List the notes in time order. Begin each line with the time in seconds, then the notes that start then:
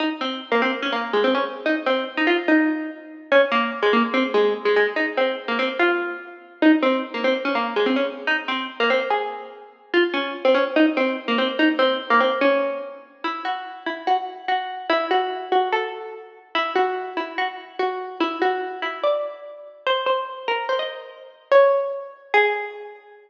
0.00 D#4
0.21 C4
0.52 A#3
0.62 C4
0.82 C#4
0.92 A#3
1.13 G#3
1.24 C4
1.35 C#4
1.66 D#4
1.86 C4
2.17 D#4
2.27 F4
2.48 D#4
3.32 C#4
3.52 A#3
3.82 G#3
3.93 A#3
4.14 C4
4.34 G#3
4.65 G#3
4.76 G#3
4.96 D#4
5.17 C4
5.48 A#3
5.59 C4
5.79 F4
6.62 D#4
6.82 C4
7.14 A#3
7.24 C4
7.45 C#4
7.55 A#3
7.76 G#3
7.86 C4
7.96 C#4
8.27 D#4
8.48 C4
8.80 A#3
8.90 C4
9.10 G#4
9.94 F4
10.14 C#4
10.45 C4
10.54 C#4
10.76 D#4
10.97 C4
11.28 A#3
11.38 C4
11.59 D#4
11.79 C4
12.10 A#3
12.20 C4
12.41 C#4
13.24 E4
13.45 F#4
13.86 E4
14.07 F#4
14.48 F#4
14.90 E4
15.11 F#4
15.52 F#4
15.72 A4
16.55 E4
16.76 F#4
17.17 E4
17.38 F#4
17.79 F#4
18.20 E4
18.42 F#4
18.82 E4
19.03 D5
19.87 C5
20.06 C5
20.48 A#4
20.69 C5
20.79 D#5
21.52 C#5
22.34 G#4